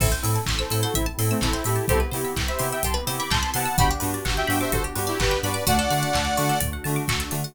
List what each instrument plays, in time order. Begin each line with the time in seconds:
0.00 synth bass 2 A1, electric piano 2 C4 E4 A4, pad 2 (warm) C4 E4 A4, pizzicato strings A4, lead 2 (sawtooth) C5 E5, kick, crash
0.12 pizzicato strings C5
0.23 synth bass 2 A2, electric piano 2 C4 E4 A4, pizzicato strings E5, open hi-hat
0.36 pizzicato strings A5
0.46 synth bass 2 A1, pizzicato strings C6, kick, clap
0.59 lead 2 (sawtooth) A4 C5, pizzicato strings E6
0.70 synth bass 2 A2, electric piano 2 C4 E4 A4, pizzicato strings A4, open hi-hat
0.83 lead 2 (sawtooth) F#4 A4, pizzicato strings C5
0.94 synth bass 2 A1, lead 2 (sawtooth) C4 E4, pizzicato strings E5, kick, closed hi-hat
1.06 pizzicato strings A5
1.18 synth bass 2 A2, electric piano 2 C4 E4 A4, pizzicato strings C6, open hi-hat
1.30 lead 2 (sawtooth) A3 C4, pizzicato strings E6
1.41 synth bass 2 A1, lead 2 (sawtooth) C4 E4, pizzicato strings A4, kick, clap
1.53 pizzicato strings C5
1.64 synth bass 2 A2, electric piano 2 C4 E4 A4, lead 2 (sawtooth) E4 G4, pizzicato strings E5, open hi-hat
1.76 pizzicato strings A5
1.88 synth bass 2 C2, pad 2 (warm) B3 C4 E4 G4, electric piano 2 B3 C4 E4 G4, pizzicato strings G4, lead 2 (sawtooth) A4 C5, kick, closed hi-hat
2.00 pizzicato strings B4
2.12 synth bass 2 C3, electric piano 2 B3 C4 E4 G4, pizzicato strings C5, open hi-hat
2.25 pizzicato strings E5
2.36 synth bass 2 C2, pizzicato strings G5, kick, clap
2.48 lead 2 (sawtooth) C5 E5, pizzicato strings B5
2.59 synth bass 2 C3, electric piano 2 B3 C4 E4 G4, pizzicato strings C6, open hi-hat
2.72 lead 2 (sawtooth) E5 G5, pizzicato strings E6
2.83 synth bass 2 C2, pizzicato strings G4, lead 2 (sawtooth) A5 C6, kick, closed hi-hat
2.94 pizzicato strings B4
3.07 synth bass 2 C3, electric piano 2 B3 C4 E4 G4, pizzicato strings C5, open hi-hat
3.18 pizzicato strings E5, lead 2 (sawtooth) B5 D6
3.30 synth bass 2 C2, pizzicato strings G5, lead 2 (sawtooth) A5 C6, kick, clap
3.43 pizzicato strings B5
3.54 synth bass 2 C3, electric piano 2 B3 C4 E4 G4, lead 2 (sawtooth) F#5 A5, pizzicato strings C6, open hi-hat
3.65 pizzicato strings E6
3.76 synth bass 2 G1, pad 2 (warm) B3 D4 F#4 G4, electric piano 2 B3 D4 F#4 G4, pizzicato strings F#4, lead 2 (sawtooth) G5 B5, kick, closed hi-hat
3.91 pizzicato strings G4
4.00 synth bass 2 G2, electric piano 2 B3 D4 F#4 G4, pizzicato strings B4, open hi-hat
4.14 pizzicato strings D5
4.25 synth bass 2 G1, pizzicato strings F#5, kick, clap
4.37 lead 2 (sawtooth) E5 G5, pizzicato strings G5
4.47 synth bass 2 G2, electric piano 2 B3 D4 F#4 G4, pizzicato strings B5, open hi-hat
4.61 lead 2 (sawtooth) C5 E5, pizzicato strings D6
4.72 synth bass 2 G1, pizzicato strings F#4, lead 2 (sawtooth) A4 C5, kick, closed hi-hat
4.84 pizzicato strings G4
4.95 synth bass 2 G2, electric piano 2 B3 D4 F#4 G4, pizzicato strings B4, open hi-hat
5.07 lead 2 (sawtooth) E4 G4, pizzicato strings D5
5.20 synth bass 2 G1, lead 2 (sawtooth) G4 B4, pizzicato strings F#5, kick, clap
5.31 pizzicato strings G5
5.43 synth bass 2 G2, electric piano 2 B3 D4 F#4 G4, lead 2 (sawtooth) B4 D5, pizzicato strings B5, open hi-hat
5.54 pizzicato strings D6
5.66 synth bass 2 D2, pad 2 (warm) A3 D4 F#4, electric piano 2 A3 D4 F#4, pizzicato strings F#4, lead 2 (sawtooth) D5 F#5, kick, closed hi-hat
5.79 pizzicato strings A4
5.90 synth bass 2 D3, electric piano 2 A3 D4 F#4, pizzicato strings D5, open hi-hat
6.03 pizzicato strings F#5
6.13 synth bass 2 D2, pizzicato strings A5, kick, clap
6.25 pizzicato strings D6
6.37 synth bass 2 D3, electric piano 2 A3 D4 F#4, pizzicato strings F#4, open hi-hat
6.49 pizzicato strings A4
6.60 synth bass 2 D2, pizzicato strings D5, kick, closed hi-hat
6.73 pizzicato strings F#5
6.84 synth bass 2 D3, electric piano 2 A3 D4 F#4, pizzicato strings A5, open hi-hat
6.96 pizzicato strings D6
7.08 synth bass 2 D2, pizzicato strings F#4, kick, clap
7.20 pizzicato strings A4
7.31 synth bass 2 D3, electric piano 2 A3 D4 F#4, pizzicato strings D5, open hi-hat
7.44 pizzicato strings F#5